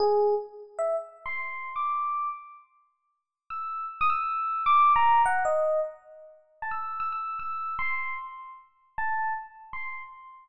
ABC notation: X:1
M:3/4
L:1/16
Q:1/4=154
K:none
V:1 name="Electric Piano 1"
_A4 z4 e2 z2 | z c'5 d'6 | z12 | e'4 z _e' =e'6 |
d'3 _b3 _g2 _e4 | z8 a e'3 | e' e'3 e'4 c'4 | z8 a4 |
z4 c'3 z5 |]